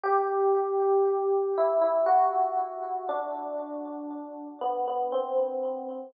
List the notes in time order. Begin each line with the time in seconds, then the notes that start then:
0.03 G4
1.57 E4
1.81 E4
2.06 F#4
3.09 D4
4.61 B3
4.87 B3
5.12 C4